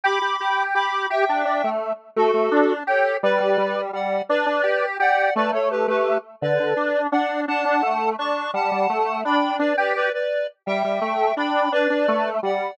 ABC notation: X:1
M:6/8
L:1/8
Q:3/8=113
K:D
V:1 name="Lead 1 (square)"
[bd']4 [bd']2 | [eg]4 z2 | [FA]4 [Ac]2 | [Bd]4 [df]2 |
[Bd]4 [df]2 | [Bd] [Ac] [GB] [GB]2 z | [Bd]4 [df]2 | [fa]4 [ac']2 |
[fa]4 [gb]2 | [Bd] [Bd] [Bd] [Bd]2 z | [eg]4 [gb]2 | [Bd]4 [df]2 |]
V:2 name="Lead 1 (square)"
G G G2 G2 | G D D A,2 z | A, A, D2 G2 | G, G, G,2 G,2 |
D D G2 G2 | A, A,2 A,2 z | D, D, D2 D2 | D D A,2 D2 |
G, G, A,2 D2 | D G2 z3 | G, G, A,2 D2 | D D A,2 G,2 |]